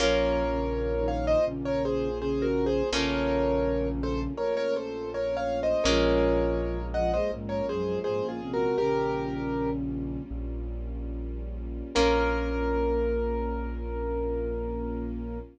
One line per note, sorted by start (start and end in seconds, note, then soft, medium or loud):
0.00 1.35 A#1 loud
0.00 0.44 F3 medium
0.00 2.63 A#3 medium
0.00 2.90 A#3 medium
0.00 2.63 C#4 medium
0.00 2.90 C#4 loud
0.00 0.44 F4 loud
0.00 2.63 F4 loud
0.00 2.90 F4 loud
0.00 1.07 A#4 medium
0.00 1.07 C#5 medium
0.49 0.93 C#3 medium
0.49 0.93 C#4 medium
0.98 1.39 D#3 medium
0.98 1.39 D#4 loud
1.08 1.25 C#5 medium
1.08 1.25 F5 medium
1.27 1.45 C5 medium
1.27 1.45 D#5 medium
1.46 2.82 A#1 loud
1.46 2.09 C#3 medium
1.46 2.09 C#4 medium
1.65 1.83 A#4 medium
1.65 1.83 C#5 medium
1.85 2.18 G#4 medium
1.85 2.18 C5 medium
2.20 2.83 C#3 medium
2.20 2.83 C#4 loud
2.20 2.45 G#4 medium
2.20 2.45 C5 medium
2.42 2.65 F#4 medium
2.42 2.65 A#4 medium
2.66 2.89 G#4 medium
2.66 2.89 C5 medium
2.92 4.27 A#1 loud
2.92 4.33 C#3 medium
2.92 5.56 A3 loud
2.92 5.82 A3 medium
2.92 5.56 A#3 medium
2.92 5.82 A#3 medium
2.92 5.56 C#4 medium
2.92 5.82 C#4 medium
2.92 4.33 C#4 loud
2.92 5.56 F4 medium
2.92 5.82 F4 medium
2.92 3.88 A#4 medium
2.92 3.88 C#5 medium
4.03 4.21 A4 medium
4.03 4.21 C5 medium
4.37 5.74 A#1 loud
4.37 4.55 A#4 medium
4.37 4.55 C#5 medium
4.57 4.74 A#4 medium
4.57 4.74 C#5 medium
4.76 5.10 A4 medium
4.76 5.10 C5 medium
5.14 5.37 A#4 medium
5.14 5.36 C#5 medium
5.37 5.60 C#5 medium
5.37 5.60 F5 medium
5.63 5.86 C5 medium
5.63 5.86 D#5 medium
5.84 7.19 A#1 loud
5.84 6.79 F3 medium
5.84 8.75 G#3 medium
5.84 8.49 G#3 loud
5.84 8.75 A#3 loud
5.84 8.49 A#3 medium
5.84 8.75 C#4 medium
5.84 8.49 C#4 medium
5.84 8.75 F4 medium
5.84 6.79 F4 loud
5.84 8.49 F4 medium
5.84 6.86 A#4 medium
5.84 6.86 C#5 medium
6.94 7.13 F3 medium
6.94 7.13 F4 loud
6.94 7.11 D#5 medium
6.94 7.11 F#5 medium
7.14 7.31 G#3 medium
7.14 7.31 G#4 medium
7.14 7.31 C5 medium
7.14 7.31 D#5 medium
7.32 8.66 A#1 loud
7.32 7.61 G#2 medium
7.32 7.61 G#3 loud
7.49 7.66 A#4 medium
7.49 7.66 C#5 medium
7.68 7.98 F#2 medium
7.68 7.98 F#3 medium
7.68 7.99 G#4 medium
7.68 7.99 C5 medium
8.04 8.22 G#2 medium
8.04 8.22 G#3 medium
8.04 8.27 G#4 medium
8.04 8.27 C5 medium
8.23 8.41 A#2 medium
8.23 8.41 A#3 medium
8.29 8.52 F4 medium
8.29 8.52 G#4 medium
8.41 8.77 C3 medium
8.41 8.77 C4 medium
8.54 8.77 F#4 medium
8.54 8.77 A#4 medium
8.78 10.18 A#1 loud
8.78 10.23 C#3 medium
8.78 11.92 G3 medium
8.78 11.92 A#3 medium
8.78 10.23 C#4 loud
8.78 11.92 C#4 medium
8.78 11.92 F4 medium
8.78 9.70 G4 medium
8.78 9.70 A#4 medium
10.31 11.82 A#1 medium
11.95 15.40 A#1 loud
11.95 15.38 A#3 loud
11.95 15.39 A#3 loud
11.95 15.38 C#4 loud
11.95 15.39 C#4 medium
11.95 15.38 F4 medium
11.95 15.39 F4 medium
11.95 15.38 A#4 loud